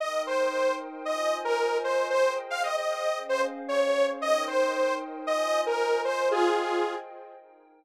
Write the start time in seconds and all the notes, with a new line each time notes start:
0.00 D#4 A#4 D#5 G5
0.27 C5
1.05 F4 C5 D#5 G#5
1.45 A#4
1.84 C5
2.10 G#4 C5 D#5 G5
2.50 F5
2.63 D#5
2.77 D#5
3.17 C#4 G#4 C5 F5
3.29 C5
3.68 C#5
4.20 D#4 A#4 D#5 G5
4.47 C5
5.27 F4 C5 D#5 G#5
5.66 A#4
6.05 C5
6.31 F4 G#4 C5 D#5 G5
7.37 D#4 A#4 G5